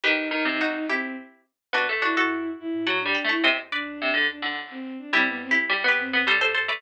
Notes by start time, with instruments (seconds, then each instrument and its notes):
0.03 flute D#2, pizzicato strings D#3, violin D#4, harpsichord G4 B4
0.31 pizzicato strings D#3
0.45 pizzicato strings C3
0.61 harpsichord D#4 F#4
0.88 flute D#2, violin C4, harpsichord E4 G4
1.73 flute D2, pizzicato strings B3, harpsichord D4 F#4
1.89 flute E2, pizzicato strings A3
2.02 harpsichord D4 F#4, violin E4
2.16 flute F#2, harpsichord F#4 A4
2.59 flute G2, violin E4
2.73 flute A2
2.87 flute A2, pizzicato strings F#3, harpsichord F#5 A5
3.00 violin D4
3.05 pizzicato strings G3
3.15 harpsichord G5 B5
3.24 pizzicato strings A3
3.29 violin E4, harpsichord A5 C#6
3.44 flute D#2, pizzicato strings C3, harpsichord C5 D#5
3.71 flute D2, violin D4, harpsichord B4 D5
4.02 pizzicato strings C3
4.14 pizzicato strings D3
4.28 violin D4
4.42 pizzicato strings D3
4.70 violin C4
4.99 violin D4
5.13 flute E2, pizzicato strings G3, violin C4, harpsichord E4 G4
5.27 flute F#2, violin B3
5.42 violin C4
5.51 harpsichord E4 G4
5.56 flute G2
5.69 pizzicato strings G3
5.84 pizzicato strings B3
5.88 harpsichord G4 B4
5.99 flute F#2, violin C4
6.13 pizzicato strings B3
6.27 pizzicato strings G3, harpsichord A4 C5
6.41 harpsichord A4 C5
6.54 harpsichord A4 C5
6.68 pizzicato strings A3, harpsichord B4 D5